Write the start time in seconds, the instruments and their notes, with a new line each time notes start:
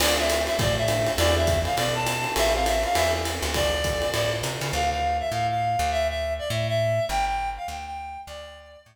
0.00 electric bass (finger) D2, acoustic grand piano C4 D4 F4 A4, clarinet D5, crash, ride
0.18 clarinet E5
0.30 hi-hat pedal, ride
0.47 clarinet E5, ride
0.59 electric bass (finger) A2, clarinet D5, kick, ride
0.77 clarinet E5
0.88 acoustic grand piano C4 D4 F4 A4, hi-hat pedal, ride
1.07 ride
1.18 electric bass (finger) E2, acoustic grand piano D4 E4 F#4 G#4, clarinet D5, ride
1.36 clarinet E5
1.47 kick, hi-hat pedal, ride
1.65 clarinet F5, ride
1.77 electric bass (finger) B2, clarinet D5, ride
1.95 clarinet A5
2.06 hi-hat pedal, ride
2.24 acoustic grand piano D4 E4 F#4 G#4, ride
2.36 electric bass (finger) A1, acoustic grand piano C4 E4 G4 A4, clarinet E5, ride
2.54 clarinet F5
2.66 clarinet E5, hi-hat pedal, ride
2.83 clarinet F5, ride
2.95 electric bass (finger) E2, clarinet E5, ride
3.13 acoustic grand piano C4 E4 G4 A4
3.25 hi-hat pedal, ride
3.42 electric bass (finger) D2, ride
3.54 clarinet D5, kick, ride
3.84 kick, hi-hat pedal, ride
4.02 ride
4.14 electric bass (finger) A2, ride
4.43 electric bass (finger) C3, hi-hat pedal, ride
4.61 electric bass (finger) C#3, ride
4.73 electric bass (finger) D2, clarinet F5
4.90 clarinet F5
5.20 clarinet E5
5.31 electric bass (finger) A2, clarinet F5
5.50 clarinet F5
5.79 electric bass (finger) D2
5.91 clarinet E5
6.09 clarinet E5
6.39 clarinet D5
6.50 electric bass (finger) A2, clarinet E5
6.68 clarinet E5
7.09 electric bass (finger) G1, clarinet G5
7.27 clarinet G5
7.57 clarinet F5
7.68 electric bass (finger) D2, clarinet G5
7.86 clarinet G5
8.27 electric bass (finger) D2, clarinet D5
8.86 electric bass (finger) A2